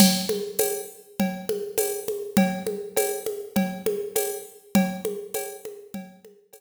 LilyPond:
\new DrumStaff \drummode { \time 4/4 \tempo 4 = 101 <cgl cb cymc>8 cgho8 <cgho cb tamb>4 <cgl cb>8 cgho8 <cgho cb tamb>8 cgho8 | <cgl cb>8 cgho8 <cgho cb tamb>8 cgho8 <cgl cb>8 cgho8 <cgho cb tamb>4 | <cgl cb>8 cgho8 <cgho cb tamb>8 cgho8 <cgl cb>8 cgho8 <cgho cb tamb>4 | }